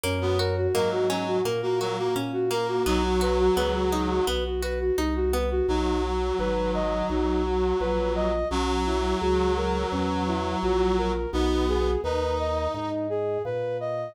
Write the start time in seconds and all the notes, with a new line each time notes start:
0.04 F#2 A#3 C#4
0.21 B3 F#4
0.39 F#4 A#4
0.57 F#4
0.74 G#2 F#3 A#3 A#4
0.92 F#4
1.09 F#3 C#4
1.27 F#4
1.45 A#2 A#3 A#4
1.62 A#3 F#4
1.80 F#3 F#4 A#4
1.98 A#3 F#4
2.16 A#2 C#4
2.33 F#4
2.51 A#3 A#4
2.69 F#4
2.86 B1 F#3 B3 D#4
3.04 F#4
3.21 F#4 B4
3.39 F#4
3.57 C#2 B3 B4
3.74 F#4
3.92 D#4
4.10 F#4
4.27 B1 B3 B4
4.45 F#4
4.62 F#4 B4
4.80 F#4
4.98 C2 D#4
5.16 F#4
5.33 B3 B4
5.51 F#4
5.68 B1 F#3 D#4
6.04 F#4
6.39 G#1 B4
6.74 D#5
7.10 B1 D#4
7.45 F#4
7.80 A#1 B4
8.16 D#5
8.51 B1 F#3 C#4
8.86 E4
9.21 C#2 F#4
9.57 A#4
9.92 E2 C#4
10.27 E4
10.62 A#1 F#4
10.98 A#4
11.33 B1 B3 D#4
11.68 G#4
12.04 D#2 D#4 B4
12.39 D#5
12.74 G#2 D#4
13.10 G#4
13.45 A#2 B4
13.80 D#5